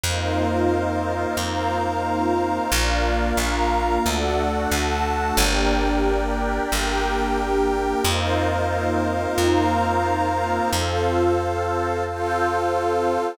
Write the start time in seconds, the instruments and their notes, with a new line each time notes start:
0.04 electric bass (finger) F2, pad 2 (warm) A#3 C4 D#4 F4, pad 5 (bowed) A#4 C5 D#5 F5
1.37 electric bass (finger) F2, pad 5 (bowed) A#4 C5 F5 A#5
2.71 electric bass (finger) A#1, pad 2 (warm) A#3 D4 F4, pad 5 (bowed) A#4 D5 F5
3.37 electric bass (finger) A#1, pad 5 (bowed) A#4 F5 A#5
4.04 electric bass (finger) D2, pad 2 (warm) A3 D4 F#4, pad 5 (bowed) A4 D5 F#5
4.71 electric bass (finger) D2, pad 5 (bowed) A4 F#5 A5
5.37 electric bass (finger) G1, pad 2 (warm) A#3 D4 G4, pad 5 (bowed) A#4 D5 G5
6.71 electric bass (finger) G1, pad 5 (bowed) G4 A#4 G5
8.04 electric bass (finger) F2, pad 2 (warm) A#3 C4 D#4 F4, pad 5 (bowed) A#4 C5 D#5 F5
9.38 electric bass (finger) F2, pad 5 (bowed) A#4 C5 F5 A#5
10.71 electric bass (finger) F2, pad 2 (warm) C4 F4 A4, pad 5 (bowed) A4 C5 F5
12.04 pad 2 (warm) C4 A4 C5, pad 5 (bowed) F4 A4 F5